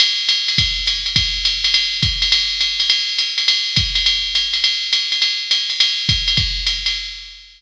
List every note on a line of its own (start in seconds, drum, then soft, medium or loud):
0.00 ride loud
0.29 hi-hat pedal medium
0.29 ride medium
0.48 ride medium
0.58 kick medium
0.58 ride loud
0.87 hi-hat pedal medium
0.87 ride medium
1.06 ride medium
1.16 kick medium
1.16 ride loud
1.45 hi-hat pedal medium
1.45 ride medium
1.64 ride medium
1.74 ride loud
2.03 kick medium
2.03 hi-hat pedal medium
2.03 ride medium
2.22 ride medium
2.32 ride loud
2.61 hi-hat pedal medium
2.61 ride medium
2.80 ride medium
2.90 ride loud
3.18 hi-hat pedal medium
3.18 ride medium
3.38 ride medium
3.48 ride loud
3.76 kick medium
3.76 hi-hat pedal medium
3.76 ride medium
3.95 ride medium
4.06 ride medium
4.35 hi-hat pedal medium
4.35 ride medium
4.53 ride medium
4.64 ride loud
4.92 hi-hat pedal medium
4.92 ride medium
5.12 ride medium
5.22 ride medium
5.51 hi-hat pedal medium
5.51 ride medium
5.70 ride medium
5.80 ride loud
6.09 kick medium
6.09 hi-hat pedal medium
6.09 ride medium
6.28 ride medium
6.37 kick medium
6.37 ride medium
6.67 hi-hat pedal medium
6.67 ride medium
6.86 ride medium